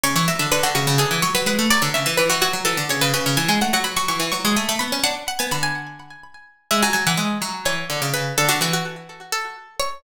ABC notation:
X:1
M:7/8
L:1/16
Q:1/4=126
K:C#phr
V:1 name="Harpsichord"
c c e e B F F2 G2 c B B2 | d c e e B F F2 A2 c B B2 | g g f f b c' c'2 c'2 g b b2 | f2 f g b g7 z2 |
e g g f z4 c4 B2 | A F F F z4 A4 c2 |]
V:2 name="Harpsichord"
C, E, F, D, D, D, C, C, D, E, F, F, G, A, | F, D, C, E, E, E, F, F, E, D, C, C, C, C, | E, G, A, F, F, F, E, E, F, G, A, A, B, C | D z2 B, D,6 z4 |
G, F, F, E, G,2 F,2 E,2 D, C, C,2 | D, D, E,10 z2 |]